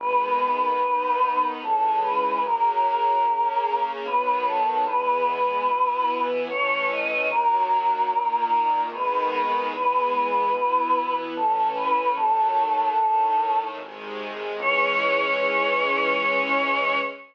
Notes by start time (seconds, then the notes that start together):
0.00 G#1 D#3 G#3 B3 B4
0.81 D#2 D#3 B3 D#4
1.62 C#2 C#3 E3 G#3 A4
2.02 B4
2.43 F#2 C#3 F#3 A#3 A#4
3.24 C#3 A#3 C#4
4.05 B1 D#3 F#3 B3 B4
4.47 A4
4.86 E2 E3 G#3 B3 B4
5.68 B2 E3 B3 E4
6.48 A1 E3 A3 C#4 C#5
6.91 D#5
7.31 D#2 D#3 F#3 A#3 A#4
8.10 A#2 D#3 A#3
8.92 G#1 D#3 G#3 B3 B4
9.72 E2 E3 G#3 B3 B4
10.53 B2 E3 B3 E4
11.36 A1 E3 A3 C#4 A4
11.76 B4
12.15 D#2 D#3 F#3 A3 A4
12.97 A2 D#3 A3
13.78 G#1 C3 D#3 G#3
14.59 C#2 E3 G#3 C#4 C#5